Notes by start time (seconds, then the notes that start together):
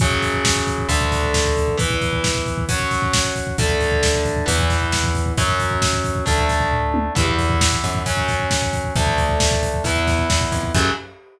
0.00 F#2 C#3 F#3, kick, closed hi-hat
0.11 kick
0.22 kick, closed hi-hat
0.33 kick
0.45 kick, snare
0.56 kick
0.67 kick, closed hi-hat
0.78 kick
0.89 D2 D3 A3, kick, closed hi-hat
1.01 kick
1.12 kick, snare, closed hi-hat
1.23 kick
1.34 kick, snare
1.45 kick
1.57 kick, closed hi-hat
1.68 kick
1.78 E3 B3, kick, closed hi-hat
1.90 kick
2.01 kick, closed hi-hat
2.13 kick
2.24 kick, snare
2.35 kick
2.46 kick, closed hi-hat
2.58 kick
2.69 F#3 C#4, kick, closed hi-hat
2.80 kick
2.91 kick, snare, closed hi-hat
3.02 kick
3.13 kick, snare
3.24 kick
3.36 kick, closed hi-hat
3.47 kick
3.58 D2 D3 A3, kick, closed hi-hat
3.70 kick
3.81 kick, closed hi-hat
3.92 kick
4.03 kick, snare
4.14 kick
4.25 kick, closed hi-hat
4.36 kick
4.46 E2 E3 B3, kick, closed hi-hat
4.59 kick
4.70 kick, snare, closed hi-hat
4.81 kick
4.92 kick, snare
5.04 kick
5.15 kick, closed hi-hat
5.26 kick
5.37 F#2 F#3 C#4, kick, closed hi-hat
5.49 kick
5.60 kick, closed hi-hat
5.71 kick
5.82 kick, snare
5.93 kick
6.04 kick, closed hi-hat
6.15 kick
6.26 D2 A3 D4, kick, closed hi-hat
6.38 kick
6.49 kick, snare, closed hi-hat
6.60 kick
6.71 kick, floor tom
6.94 high tom
7.15 E2 E3 B3, kick, crash
7.28 kick
7.39 kick, closed hi-hat
7.50 kick
7.61 kick, snare
7.72 kick
7.84 F#2, kick, closed hi-hat
7.95 kick
8.06 F#3 C#4, kick, closed hi-hat
8.17 kick
8.28 kick, snare, closed hi-hat
8.40 kick
8.51 kick, snare
8.62 kick
8.73 kick, closed hi-hat
8.84 kick
8.96 D2 A3 D4, kick, closed hi-hat
9.07 kick
9.18 kick, closed hi-hat
9.29 kick
9.40 kick, snare
9.51 kick
9.63 kick, closed hi-hat
9.74 kick
9.84 E2 B3 E4, kick, closed hi-hat
9.96 kick
10.07 kick, snare, closed hi-hat
10.19 kick
10.30 E2, kick, snare
10.41 kick
10.52 F2, kick, closed hi-hat
10.63 kick
10.75 F#2 C#3 F#3, kick, crash